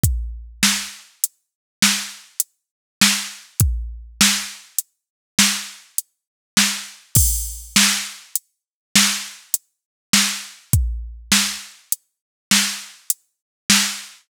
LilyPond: \new DrumStaff \drummode { \time 6/4 \tempo 4 = 101 <hh bd>4 sn4 hh4 sn4 hh4 sn4 | <hh bd>4 sn4 hh4 sn4 hh4 sn4 | <cymc bd>4 sn4 hh4 sn4 hh4 sn4 | <hh bd>4 sn4 hh4 sn4 hh4 sn4 | }